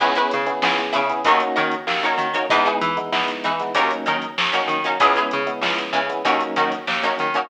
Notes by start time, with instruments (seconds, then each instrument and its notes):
0.00 electric bass (finger) C#2, electric piano 1 B3 C#4 E4 G#4, pizzicato strings E4 G#4 B4 C#5, kick, crash
0.15 pizzicato strings E4 G#4 B4 C#5, closed hi-hat
0.31 electric bass (finger) C#3, closed hi-hat
0.46 electric piano 1 B3 C#4 E4 G#4, closed hi-hat
0.62 electric bass (finger) C#2, electric piano 1 B3 C#4 E4 G#4, snare
0.78 closed hi-hat
0.92 electric bass (finger) C#3, pizzicato strings E4 G#4 B4 C#5, closed hi-hat
1.10 electric piano 1 B3 C#4 E4 G#4, closed hi-hat
1.24 electric bass (finger) D#2, electric piano 1 A#3 C#4 D#4 F#4, pizzicato strings D#4 F#4 A#4 C#5, kick, closed hi-hat
1.40 closed hi-hat
1.55 electric bass (finger) D#3, pizzicato strings D#4 F#4 A#4 C#5, closed hi-hat
1.71 closed hi-hat
1.87 electric bass (finger) D#2, snare
2.03 electric piano 1 A#3 C#4 D#4 F#4, pizzicato strings D#4 F#4 A#4 C#5, closed hi-hat
2.18 electric bass (finger) D#3, closed hi-hat
2.33 electric piano 1 A#3 C#4 D#4 F#4, pizzicato strings D#4 F#4 A#4 C#5, closed hi-hat
2.50 electric bass (finger) E2, electric piano 1 G#3 B3 D#4 E4, pizzicato strings D#4 E4 G#4 B4, kick, closed hi-hat
2.65 pizzicato strings D#4 E4 G#4 B4, closed hi-hat
2.81 electric bass (finger) E3, snare, closed hi-hat
2.97 electric piano 1 G#3 B3 D#4 E4, closed hi-hat
3.12 electric bass (finger) E2, electric piano 1 G#3 B3 D#4 E4, snare
3.28 closed hi-hat
3.44 electric bass (finger) E3, pizzicato strings D#4 E4 G#4 B4, closed hi-hat
3.60 electric piano 1 G#3 B3 D#4 E4, snare, closed hi-hat
3.75 electric bass (finger) D#2, electric piano 1 F#3 A#3 C#4 D#4, pizzicato strings C#4 D#4 F#4 A#4, kick, closed hi-hat
3.91 closed hi-hat
4.06 electric bass (finger) D#3, pizzicato strings C#4 D#4 F#4 A#4, closed hi-hat
4.22 closed hi-hat
4.38 electric bass (finger) D#2, snare
4.53 electric piano 1 F#3 A#3 C#4 D#4, pizzicato strings C#4 D#4 F#4 A#4, closed hi-hat
4.68 electric bass (finger) D#3, closed hi-hat
4.84 electric piano 1 F#3 A#3 C#4 D#4, pizzicato strings C#4 D#4 F#4 A#4, closed hi-hat
5.00 electric bass (finger) C#2, electric piano 1 G#3 B3 C#4 E4, pizzicato strings C#4 E4 G#4 B4, kick, closed hi-hat
5.16 pizzicato strings C#4 E4 G#4 B4, closed hi-hat
5.31 electric bass (finger) C#3, closed hi-hat
5.47 electric piano 1 G#3 B3 C#4 E4, closed hi-hat
5.61 electric bass (finger) C#2, electric piano 1 G#3 B3 C#4 E4, snare
5.78 closed hi-hat
5.93 electric bass (finger) C#3, pizzicato strings C#4 E4 G#4 B4, closed hi-hat
6.10 electric piano 1 G#3 B3 C#4 E4, closed hi-hat
6.24 electric bass (finger) D#2, electric piano 1 F#3 A#3 C#4 D#4, pizzicato strings C#4 D#4 F#4 A#4, kick, closed hi-hat
6.40 closed hi-hat
6.56 electric bass (finger) D#3, pizzicato strings C#4 D#4 F#4 A#4, snare, closed hi-hat
6.72 snare, closed hi-hat
6.87 electric bass (finger) D#2, snare
7.03 electric piano 1 F#3 A#3 C#4 D#4, pizzicato strings C#4 D#4 F#4 A#4, closed hi-hat
7.19 electric bass (finger) D#3, closed hi-hat
7.34 electric piano 1 F#3 A#3 C#4 D#4, pizzicato strings C#4 D#4 F#4 A#4, closed hi-hat